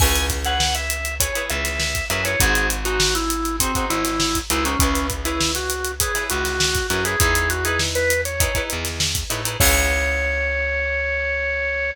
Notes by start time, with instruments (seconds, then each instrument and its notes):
0.00 electric bass (finger) C#2, acoustic guitar (steel) E4 G#4 B4 C#5, drawbar organ G#5, kick, crash
0.15 snare, closed hi-hat
0.30 kick, snare, closed hi-hat
0.45 acoustic guitar (steel) E4 G#4 B4 C#5, drawbar organ F#5, closed hi-hat
0.60 snare
0.75 drawbar organ E5, closed hi-hat
0.90 closed hi-hat
1.05 closed hi-hat
1.20 acoustic guitar (steel) E4 G#4 B4 C#5, drawbar organ C#5, kick, closed hi-hat
1.35 acoustic guitar (steel) E4 G#4 B4 C#5, closed hi-hat
1.50 electric bass (finger) C#2, drawbar organ E5, closed hi-hat
1.65 snare, closed hi-hat
1.79 snare
1.95 kick, closed hi-hat
2.10 electric bass (finger) F#2, acoustic guitar (steel) E4 G#4 B4 C#5, drawbar organ E5, closed hi-hat
2.25 acoustic guitar (steel) E4 G#4 B4 C#5, drawbar organ C#5, closed hi-hat
2.40 electric bass (finger) G#1, acoustic guitar (steel) D#4 F#4 G#4 C5, drawbar organ G#4, kick, closed hi-hat
2.55 closed hi-hat
2.70 closed hi-hat
2.85 acoustic guitar (steel) D#4 F#4 G#4 C5, drawbar organ F#4, closed hi-hat
3.00 snare
3.15 drawbar organ E4, closed hi-hat
3.30 closed hi-hat
3.45 closed hi-hat
3.60 drawbar organ C4, acoustic guitar (steel) D#4 F#4 G#4 C5, kick, closed hi-hat
3.75 acoustic guitar (steel) D#4 F#4 G#4 C5, kick, closed hi-hat
3.90 electric bass (finger) G#1, drawbar organ E4, closed hi-hat
4.05 snare, closed hi-hat
4.20 snare
4.35 kick, closed hi-hat
4.50 electric bass (finger) C#2, acoustic guitar (steel) D#4 F#4 G#4 C5, drawbar organ E4, closed hi-hat
4.65 drawbar organ C#4, acoustic guitar (steel) D#4 F#4 G#4 C5, closed hi-hat
4.79 electric bass (finger) C#2, drawbar organ C#4, acoustic guitar (steel) E4 G#4 B4 C#5, kick, closed hi-hat
4.95 snare, closed hi-hat
5.10 kick, closed hi-hat
5.25 drawbar organ E4, acoustic guitar (steel) E4 G#4 B4 C#5, closed hi-hat
5.41 snare
5.55 drawbar organ F#4, snare, closed hi-hat
5.70 closed hi-hat
5.84 closed hi-hat
6.00 acoustic guitar (steel) E4 G#4 B4 C#5, drawbar organ G#4, kick, closed hi-hat
6.15 acoustic guitar (steel) E4 G#4 B4 C#5, snare, closed hi-hat
6.30 electric bass (finger) C#2, drawbar organ F#4, closed hi-hat
6.45 snare, closed hi-hat
6.60 snare
6.75 kick, closed hi-hat
6.90 electric bass (finger) F#2, acoustic guitar (steel) E4 G#4 B4 C#5, drawbar organ F#4, closed hi-hat
7.05 acoustic guitar (steel) E4 G#4 B4 C#5, drawbar organ G#4, closed hi-hat
7.20 electric bass (finger) E2, acoustic guitar (steel) D#4 E4 G#4 B4, drawbar organ G#4, kick, closed hi-hat
7.35 closed hi-hat
7.50 drawbar organ F#4, closed hi-hat
7.65 acoustic guitar (steel) D#4 E4 G#4 B4, drawbar organ G#4, closed hi-hat
7.79 snare
7.95 drawbar organ B4, closed hi-hat
8.10 closed hi-hat
8.25 drawbar organ C#5, closed hi-hat
8.40 acoustic guitar (steel) D#4 E4 G#4 B4, kick, closed hi-hat
8.55 acoustic guitar (steel) D#4 E4 G#4 B4, kick, closed hi-hat
8.70 electric bass (finger) E2, closed hi-hat
8.85 snare, closed hi-hat
9.00 snare
9.15 kick, closed hi-hat
9.30 electric bass (finger) A2, acoustic guitar (steel) D#4 E4 G#4 B4, closed hi-hat
9.45 acoustic guitar (steel) D#4 E4 G#4 B4, closed hi-hat
9.60 electric bass (finger) C#2, acoustic guitar (steel) E4 G#4 B4 C#5, drawbar organ C#5, kick, crash